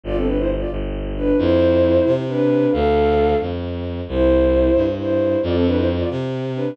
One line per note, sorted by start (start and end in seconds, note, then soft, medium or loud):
0.04 0.64 G1 medium
0.04 0.16 F4 medium
0.04 0.16 D5 loud
0.15 0.26 C4 medium
0.15 0.26 A4 medium
0.26 0.37 D4 medium
0.26 0.37 B4 medium
0.37 0.48 E4 medium
0.37 0.48 C5 medium
0.59 0.70 F4 medium
0.59 0.70 D5 medium
0.71 1.32 G1 medium
1.16 1.37 D4 medium
1.16 1.37 B4 medium
1.37 1.99 F2 medium
1.37 2.11 E4 medium
1.37 2.11 C5 medium
2.06 2.66 C3 medium
2.28 2.72 D4 medium
2.28 2.72 B4 medium
2.71 3.34 D2 medium
2.71 3.35 A4 medium
2.71 3.35 F5 medium
3.41 4.01 F2 medium
4.08 4.69 C2 medium
4.08 4.83 E4 medium
4.08 4.83 C5 medium
4.75 5.36 G2 medium
4.98 5.39 E4 medium
4.98 5.39 C5 medium
5.43 6.03 F2 loud
5.43 5.55 F4 medium
5.43 5.55 D5 medium
5.54 5.64 C4 medium
5.54 5.64 A4 medium
5.65 5.76 D4 medium
5.65 5.76 B4 medium
5.76 5.86 E4 medium
5.76 5.86 C5 medium
5.99 6.09 F4 medium
5.99 6.09 D5 medium
6.10 6.71 C3 medium
6.55 6.74 D4 medium
6.55 6.74 B4 medium